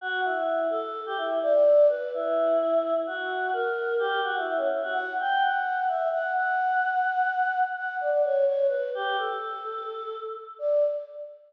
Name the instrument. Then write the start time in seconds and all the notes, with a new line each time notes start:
choir aahs
0.01 F#4
0.24 E4
0.70 A4
1.06 G4
1.17 E4
1.43 D5
1.89 B4
2.14 E4
3.07 F#4
3.53 A#4
3.99 G4
4.24 F#4
4.37 E4
4.47 E4
4.57 C#4
4.72 E4
4.83 F#4
4.93 F#5
5.20 G5
5.42 F#5
5.88 E5
6.12 F#5
6.35 F#5
7.76 F#5
8.00 D5
8.11 D5
8.24 C#5
8.46 C#5
8.68 B4
8.95 G4
9.18 A4
10.59 D5